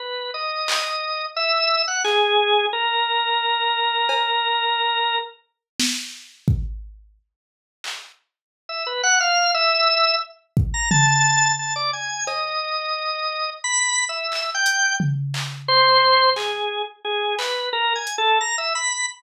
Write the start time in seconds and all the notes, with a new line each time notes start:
0.00 B4
0.34 D#5
0.68 clap
1.37 E5
1.88 F#5
2.04 G#4, clap
2.73 A#4
4.09 cowbell
5.80 snare
6.48 kick
7.84 clap
8.69 E5
8.87 B4
9.03 F#5
9.20 F5
9.54 E5
10.57 kick
10.74 A#5
10.91 A5, floor tom
11.59 A5
11.76 D5
11.93 G#5
12.27 D#5, cowbell
13.64 B5
14.09 E5
14.32 clap
14.55 G5
14.66 closed hi-hat
15.00 floor tom
15.34 clap
15.68 C5
16.36 G#4, clap
17.05 G#4
17.39 B4, clap
17.73 A#4
17.95 G#5
18.07 closed hi-hat
18.18 A4
18.41 A#5
18.58 E5
18.75 B5